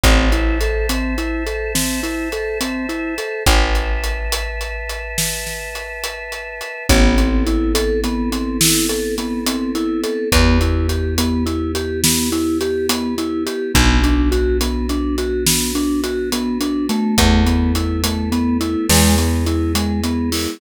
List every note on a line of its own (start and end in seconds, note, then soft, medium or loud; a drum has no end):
0.04 3.19 A1 medium
0.04 0.29 C4 medium
0.04 3.43 C5 medium
0.04 3.43 E5 medium
0.04 3.43 A5 medium
0.04 kick loud
0.04 closed hi-hat loud
0.32 0.58 E4 medium
0.32 closed hi-hat medium
0.61 0.87 A4 medium
0.61 closed hi-hat medium
0.89 1.15 C4 medium
0.89 closed hi-hat medium
1.18 1.44 E4 medium
1.18 closed hi-hat medium
1.47 1.72 A4 medium
1.47 closed hi-hat medium
1.75 2.01 C4 medium
1.75 snare medium
2.03 2.29 E4 medium
2.03 closed hi-hat medium
2.32 2.58 A4 medium
2.32 closed hi-hat medium
2.61 2.86 C4 medium
2.61 closed hi-hat loud
2.89 3.15 E4 medium
2.89 closed hi-hat medium
3.18 3.44 A4 medium
3.18 closed hi-hat medium
3.46 6.62 A1 medium
3.46 6.86 B4 medium
3.46 6.86 E5 medium
3.46 6.86 A5 medium
3.46 kick loud
3.46 closed hi-hat loud
3.75 closed hi-hat medium
4.04 closed hi-hat medium
4.32 closed hi-hat loud
4.61 closed hi-hat medium
4.90 closed hi-hat medium
5.18 snare loud
5.47 snare medium
5.75 closed hi-hat medium
6.04 closed hi-hat medium
6.32 closed hi-hat medium
6.61 closed hi-hat medium
6.89 10.05 A1 medium
6.89 7.15 B3 loud
6.89 10.29 B3 medium
6.89 10.29 C4 medium
6.89 10.29 E4 medium
6.89 10.29 A4 medium
6.89 kick loud
6.89 closed hi-hat loud
7.17 7.43 C4 medium
7.17 closed hi-hat medium
7.47 7.72 E4 medium
7.47 closed hi-hat medium
7.75 8.00 A4 loud
7.75 closed hi-hat loud
8.04 8.30 B3 loud
8.04 closed hi-hat medium
8.32 8.58 C4 medium
8.32 closed hi-hat medium
8.61 8.86 E4 medium
8.61 snare loud
8.89 9.15 A4 medium
8.89 closed hi-hat medium
9.18 9.44 B3 medium
9.18 closed hi-hat medium
9.46 9.72 C4 medium
9.46 closed hi-hat loud
9.75 10.01 E4 medium
9.75 closed hi-hat medium
10.04 10.29 A4 medium
10.04 closed hi-hat medium
10.32 13.48 E2 loud
10.32 10.58 B3 loud
10.32 13.72 B3 medium
10.32 13.72 E4 medium
10.32 13.72 G4 medium
10.32 kick loud
10.32 closed hi-hat loud
10.61 10.87 E4 medium
10.61 closed hi-hat medium
10.89 11.15 G4 medium
10.89 closed hi-hat medium
11.18 11.44 B3 medium
11.18 closed hi-hat loud
11.46 11.72 E4 medium
11.46 closed hi-hat medium
11.75 12.01 G4 medium
11.75 closed hi-hat medium
12.04 12.30 B3 loud
12.04 snare loud
12.32 12.58 E4 medium
12.32 closed hi-hat medium
12.61 12.87 G4 medium
12.61 closed hi-hat medium
12.89 13.15 B3 loud
12.89 closed hi-hat loud
13.18 13.44 E4 medium
13.18 closed hi-hat medium
13.46 13.72 G4 medium
13.46 closed hi-hat medium
13.75 16.90 B1 loud
13.75 14.00 B3 loud
13.75 17.15 B3 medium
13.75 17.15 D4 medium
13.75 17.15 F#4 medium
13.75 kick loud
13.75 closed hi-hat loud
14.03 14.29 D4 medium
14.03 closed hi-hat medium
14.32 14.57 F#4 medium
14.32 closed hi-hat medium
14.61 14.87 B3 medium
14.61 closed hi-hat loud
14.89 15.16 D4 medium
14.89 closed hi-hat medium
15.18 15.44 F#4 medium
15.18 closed hi-hat medium
15.47 15.72 B3 medium
15.47 snare loud
15.75 16.01 D4 loud
15.75 closed hi-hat medium
16.04 16.30 F#4 medium
16.04 closed hi-hat medium
16.32 16.58 B3 medium
16.32 closed hi-hat loud
16.61 16.86 D4 medium
16.61 closed hi-hat medium
16.89 17.44 A3 loud
16.89 closed hi-hat medium
17.18 18.76 E2 medium
17.18 18.88 A3 medium
17.18 18.88 B3 medium
17.18 18.88 E4 medium
17.18 kick loud
17.18 closed hi-hat loud
17.46 17.72 B3 medium
17.46 closed hi-hat medium
17.75 18.01 E4 medium
17.75 closed hi-hat medium
18.04 18.30 A3 medium
18.04 closed hi-hat loud
18.32 18.58 B3 loud
18.32 closed hi-hat medium
18.61 18.86 E4 medium
18.61 closed hi-hat medium
18.89 20.47 E2 medium
18.89 20.59 G#3 medium
18.89 19.15 G#3 loud
18.89 20.59 B3 medium
18.89 20.59 E4 medium
18.89 snare loud
19.18 19.44 B3 medium
19.18 closed hi-hat medium
19.46 19.72 E4 medium
19.46 closed hi-hat medium
19.75 20.01 G#3 medium
19.75 closed hi-hat loud
20.04 20.30 B3 medium
20.04 closed hi-hat medium
20.32 20.58 E4 medium
20.32 open hi-hat medium